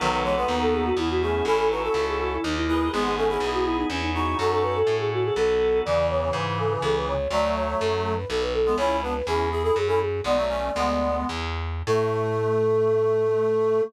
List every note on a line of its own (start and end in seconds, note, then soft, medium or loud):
0.00 0.45 B1 loud
0.00 0.23 D#3 medium
0.00 0.23 F#3 medium
0.00 0.95 B3 loud
0.00 0.95 D#4 loud
0.00 0.95 F#4 medium
0.00 0.95 A4 medium
0.00 0.11 B4 medium
0.12 0.23 B4 medium
0.24 0.36 E3 medium
0.24 0.36 G#3 medium
0.24 0.36 C#5 medium
0.37 0.48 G#3 medium
0.37 0.48 B3 medium
0.37 0.58 B4 medium
0.48 0.92 D#2 medium
0.48 0.90 B3 medium
0.48 0.90 D#4 medium
0.61 0.73 A4 medium
0.73 0.84 G#4 medium
0.86 0.97 F#4 medium
0.97 1.41 E2 loud
0.97 1.46 B3 medium
0.97 1.09 E4 medium
0.97 1.44 E4 loud
0.97 1.46 G#4 medium
1.10 1.22 F#4 medium
1.22 1.44 A3 medium
1.22 1.44 C#4 medium
1.22 1.46 G#4 medium
1.45 1.89 A1 loud
1.45 2.41 C#4 medium
1.45 1.69 C#4 medium
1.45 2.41 E4 loud
1.45 1.69 E4 medium
1.45 2.41 A4 medium
1.45 1.57 A4 medium
1.58 1.69 A4 medium
1.71 1.82 D#4 medium
1.71 1.82 F#4 medium
1.71 1.83 B4 medium
1.83 1.94 F#4 medium
1.83 1.94 A4 medium
1.83 2.03 A4 medium
1.94 2.38 C#2 medium
1.94 2.36 F#4 medium
1.94 2.36 A4 medium
2.07 2.19 G#4 medium
2.20 2.31 F#4 medium
2.32 2.44 E4 medium
2.44 2.89 D#2 loud
2.44 2.92 D#4 medium
2.44 2.56 D#4 medium
2.44 2.92 G4 medium
2.44 2.92 A#4 medium
2.56 2.67 E4 medium
2.68 2.88 E4 medium
2.68 2.92 G#4 medium
2.68 2.92 B4 medium
2.92 3.38 G#1 loud
2.92 3.15 G#3 medium
2.92 3.15 B3 medium
2.92 3.89 B3 medium
2.92 3.89 D#4 medium
2.92 3.04 G#4 medium
2.92 3.89 G#4 medium
3.05 3.17 G#4 medium
3.17 3.29 A3 medium
3.17 3.29 C#4 medium
3.17 3.29 A4 medium
3.29 3.41 C#4 medium
3.29 3.41 E4 medium
3.29 3.50 G#4 medium
3.40 3.84 B1 medium
3.40 3.86 E4 medium
3.40 3.86 G#4 medium
3.54 3.65 F#4 medium
3.65 3.77 E4 medium
3.78 3.90 D#4 medium
3.90 4.35 E2 loud
3.90 4.02 C#4 medium
3.90 4.38 C#4 medium
3.90 4.38 E4 medium
3.90 4.38 G#4 medium
4.03 4.14 D#4 medium
4.14 4.36 D#4 medium
4.14 4.37 D#4 medium
4.14 4.37 F#4 medium
4.39 4.83 F#2 loud
4.39 5.34 C#4 medium
4.39 4.78 D#4 medium
4.39 5.34 F#4 medium
4.39 4.78 F#4 medium
4.39 5.34 A4 loud
4.39 4.50 A4 medium
4.51 4.62 A4 medium
4.63 4.74 B4 medium
4.75 4.95 A4 medium
4.87 5.31 A2 medium
4.99 5.11 G#4 medium
5.13 5.25 F#4 medium
5.24 5.36 G#4 medium
5.36 5.81 B1 loud
5.36 5.84 B3 loud
5.36 5.84 D#4 medium
5.36 5.84 F#4 medium
5.36 5.84 A4 loud
5.36 5.78 A4 medium
5.85 6.30 E2 loud
5.85 7.14 C#3 medium
5.85 7.14 E3 medium
5.85 6.07 D5 medium
6.10 6.21 C#5 medium
6.21 6.33 C#5 medium
6.33 6.77 G#2 medium
6.33 6.57 B4 medium
6.59 6.71 A4 medium
6.71 6.82 B4 medium
6.82 7.27 C#2 loud
6.82 6.95 A4 medium
6.95 7.07 B4 medium
7.08 7.29 C#5 medium
7.30 7.74 D2 loud
7.30 8.14 F#3 medium
7.30 8.14 A3 medium
7.30 7.52 D5 medium
7.56 7.67 C#5 medium
7.68 7.80 C#5 medium
7.80 8.25 F#2 medium
7.80 8.02 A4 medium
8.04 8.16 A4 medium
8.16 8.28 B4 medium
8.29 8.75 B1 loud
8.29 8.41 A4 medium
8.42 8.53 B4 medium
8.54 8.74 A4 medium
8.66 8.77 G#3 medium
8.66 8.77 B3 medium
8.77 9.22 C#2 loud
8.77 9.01 C#4 medium
8.77 9.01 E4 medium
8.77 8.97 C#5 medium
9.03 9.14 B3 medium
9.03 9.14 D4 medium
9.03 9.14 B4 medium
9.15 9.26 B4 medium
9.27 9.71 E2 medium
9.27 9.49 C#4 medium
9.27 9.49 E4 medium
9.27 9.49 G#4 medium
9.51 9.63 E4 medium
9.51 9.63 G#4 medium
9.63 9.75 E4 medium
9.63 9.75 G#4 medium
9.63 9.75 A4 medium
9.76 10.21 F#2 loud
9.76 9.88 G#4 medium
9.88 9.99 C#4 medium
9.88 9.99 E4 medium
9.88 9.99 A4 medium
10.01 10.21 G#4 medium
10.24 10.70 B1 loud
10.24 10.36 G#3 medium
10.24 10.36 B3 medium
10.24 11.15 D5 medium
10.37 10.49 F#3 medium
10.37 10.49 A3 medium
10.49 10.71 A3 medium
10.49 10.71 C#4 medium
10.75 11.24 D2 loud
10.75 11.27 G#3 medium
10.75 11.27 B3 medium
11.29 11.83 E2 medium
11.87 13.81 A2 loud
11.87 13.81 A3 loud
11.87 13.81 A4 loud